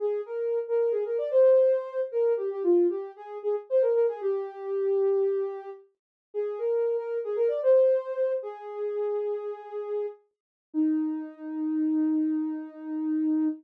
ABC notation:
X:1
M:4/4
L:1/16
Q:1/4=114
K:Eb
V:1 name="Ocarina"
A2 B3 B2 A B d c6 | B2 G G F2 G2 A2 A z c B B A | G14 z2 | A2 B3 B2 A B d c6 |
"^rit." A12 z4 | E16 |]